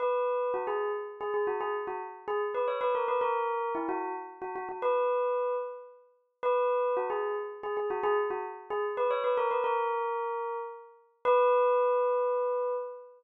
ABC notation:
X:1
M:3/4
L:1/16
Q:1/4=112
K:B
V:1 name="Tubular Bells"
B4 F G2 z2 G G F | G z F z2 G z B c B A B | A4 E F2 z2 F F F | B6 z6 |
B4 F G2 z2 G G F | G z F z2 G z B c B A B | A8 z4 | B12 |]